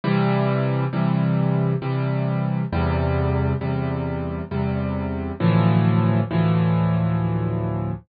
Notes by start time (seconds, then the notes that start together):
0.04 C3 E3 G3
0.93 C3 E3 G3
1.82 C3 E3 G3
2.73 E2 C3 G3
3.61 E2 C3 G3
4.51 E2 C3 G3
5.40 D2 A2 E3 F3
6.31 D2 A2 E3 F3